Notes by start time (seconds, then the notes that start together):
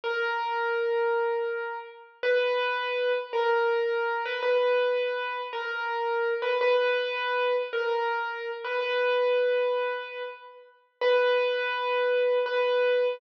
0.04 A#4
2.23 B4
3.33 A#4
4.25 B4
4.43 B4
5.53 A#4
6.42 B4
6.61 B4
7.73 A#4
8.64 B4
8.81 B4
11.01 B4
12.46 B4